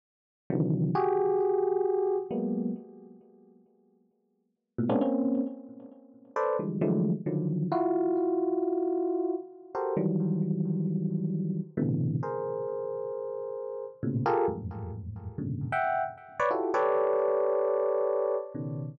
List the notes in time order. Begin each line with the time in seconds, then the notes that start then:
0.50 C3 D3 D#3 E3 F#3
0.95 F#4 G4 G#4
2.31 F#3 G#3 A#3 B3
4.78 A2 A#2 B2
4.89 G#3 A#3 B3 C4 C#4 D4
5.01 A#3 C4 C#4
6.36 A4 B4 C5 D5
6.59 D3 E3 F3 G3 G#3
6.81 D3 E3 F3 F#3 G#3 A3
7.26 D3 D#3 F3 F#3
7.72 E4 F4 F#4
9.75 F#4 G4 A4 A#4 C5
9.97 D#3 E3 F#3 G3
11.77 A2 B2 C3 D3 E3
12.23 G#4 A#4 C5
14.03 A2 A#2 B2 C#3
14.26 F4 G4 G#4 A4 A#4
14.48 E2 F2 F#2 G#2 A2
15.38 F#2 G#2 A#2 B2 C#3 D3
15.72 E5 F#5 G5
16.39 B4 C#5 D5
16.51 E4 F4 F#4 G4 A4
16.74 G4 A4 B4 C#5 D5
18.55 B2 C#3 D#3